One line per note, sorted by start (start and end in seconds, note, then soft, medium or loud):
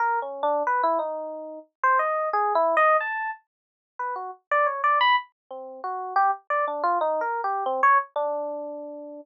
0.00 0.19 A#4 medium
0.22 0.42 C#4 medium
0.43 0.63 D4 loud
0.67 0.82 B4 medium
0.83 0.98 E4 loud
0.99 1.59 D#4 medium
1.83 1.98 C5 loud
1.99 2.29 D#5 medium
2.33 2.53 G#4 loud
2.55 2.75 E4 loud
2.77 2.97 D#5 loud
3.01 3.31 A5 medium
3.99 4.14 B4 medium
4.16 4.31 F#4 medium
4.51 4.66 D5 loud
4.66 4.81 C#5 soft
4.84 4.99 D5 loud
5.01 5.16 B5 loud
5.51 5.81 C4 medium
5.84 6.14 F#4 medium
6.16 6.31 G4 loud
6.50 6.65 D5 medium
6.68 6.83 D4 medium
6.83 6.98 F4 loud
7.01 7.21 D#4 loud
7.21 7.41 A#4 medium
7.44 7.64 G4 medium
7.66 7.81 C4 loud
7.83 7.98 C#5 loud
8.16 9.21 D4 loud